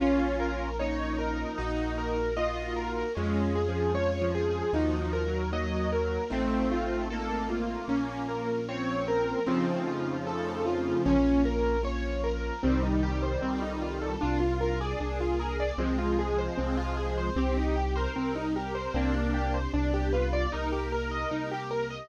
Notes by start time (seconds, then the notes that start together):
0.00 A#1 A#3 C#4 F4
0.40 A#4
0.79 F3 A#3 C#4 D#4 F4 C#5
1.18 A#4
1.58 A#1 A#3 D#4 F#4
1.98 A#4
2.36 A#3 D#4 F4 F#4 A#4 D#5
2.76 A#4
3.15 F2 G#3 C#4 F4
3.55 G#4
3.68 F3
3.94 G#3 C#4 F4 G#4 C#5
4.21 F3
4.35 G#4
4.73 D#2 F3 A#3 D#4 F#4
5.00 F3
5.13 A#4
5.26 F#3
5.52 F#3 A#3 D#4 F#4 A#4 D#5
5.92 A#4
6.30 A1 A3 C4 D#4 F4
6.72 F4
7.10 A3 A#3 C4 D#4 F4 A4
7.50 F4
7.88 A#1 A#3 C#4 F4
8.29 A#4
8.67 F3 A#3 C4 C#4 F4 C#5
9.08 A#4
9.46 F2 C#3 F3 A3 C4 D#4 F4
9.87 F4
10.26 A3 C4 D#4 F4 A4
10.66 F4
11.05 A#1 A#3 C#4 F4
11.45 A#4
11.83 F3 A#3 C#4 F4 C#5
12.24 A#4
12.63 C2 D#3 G3 C4 D#4 G4
12.83 D#4
13.03 G4
13.23 C5
13.42 C2 C4 D#4 F4 A4
13.62 D#4
13.82 F4
14.01 A4
14.21 C2 D4 F4 A#4
14.40 F4
14.61 A#4
14.80 G#4 D5
14.99 C2 A#3 D4 A#4
15.20 F4
15.39 G#4 A#4
15.60 D5
15.78 C2 F3 G#3 C4 F4 G#4
15.98 F4
16.19 G#4
16.38 C5
16.57 C2 C4 G#4 C5
16.77 F4
16.97 G#4
17.18 C5
17.36 C2 C4 D#4 G4
17.57 D#4
17.76 G4
17.96 A#4 C5
18.16 C2 G3 C4 G4
18.36 D#4
18.55 G4 A#4
18.75 C5
18.94 C2 A#3 C4 D4 G4
19.14 D4
19.34 G4
19.54 C5
19.74 C2 B3 D4 G4
19.94 G4
20.13 F4 B4
20.33 D5
20.52 C2 A#3 D#4 G4 A#4
20.72 G4
20.92 A#4
21.11 D#5
21.31 C2 A#3 D#4 G4 A#4
21.51 G4
21.71 A#4
21.90 D#5